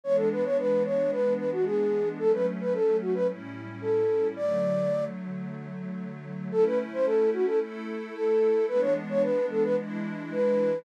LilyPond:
<<
  \new Staff \with { instrumentName = "Flute" } { \time 4/4 \key a \major \tempo 4 = 111 cis''16 a'16 b'16 cis''16 b'8 cis''8 b'8 b'16 fis'16 gis'4 | a'16 b'16 r16 b'16 a'8 fis'16 b'16 r4 a'4 | d''4. r2 r8 | a'16 b'16 r16 c''16 a'8 fis'16 a'16 r4 a'4 |
b'16 cis''16 r16 cis''16 b'8 a'16 b'16 r4 b'4 | }
  \new Staff \with { instrumentName = "Pad 5 (bowed)" } { \time 4/4 \key a \major <e gis b d'>1 | <fis a cis'>2 <a, g cis' e'>2 | <d fis a>1 | <a cis' e'>2 <a e' a'>2 |
<e gis b d'>2 <e gis d' e'>2 | }
>>